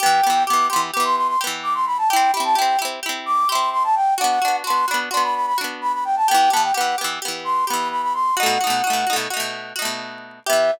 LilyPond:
<<
  \new Staff \with { instrumentName = "Flute" } { \time 9/8 \key e \minor \tempo 4. = 86 g''4 d'''8 c'''16 r16 d'''16 c'''16 c'''16 c'''16 r8 d'''16 c'''16 b''16 a''16 | g''8 b''16 a''16 g''8 r4 d'''8 c'''8 c'''16 a''16 g''8 | fis''4 c'''8 b''16 r16 c'''16 b''16 b''16 b''16 r8 b''16 b''16 g''16 a''16 | g''8 a''16 g''16 fis''8 r4 c'''8 b''8 b''16 b''16 c'''8 |
fis''2 r2 r8 | e''4. r2. | }
  \new Staff \with { instrumentName = "Pizzicato Strings" } { \time 9/8 \key e \minor <e b g'>8 <e b g'>8 <e b g'>8 <e b g'>8 <e b g'>4 <e b g'>4. | <c' e' g'>8 <c' e' g'>8 <c' e' g'>8 <c' e' g'>8 <c' e' g'>4 <c' e' g'>4. | <b d' fis'>8 <b d' fis'>8 <b d' fis'>8 <b d' fis'>8 <b d' fis'>4 <b d' fis'>4. | <e b g'>8 <e b g'>8 <e b g'>8 <e b g'>8 <e b g'>4 <e b g'>4. |
<b, a dis' fis'>8 <b, a dis' fis'>8 <b, a dis' fis'>8 <b, a dis' fis'>8 <b, a dis' fis'>4 <b, a dis' fis'>4. | <e b g'>4. r2. | }
>>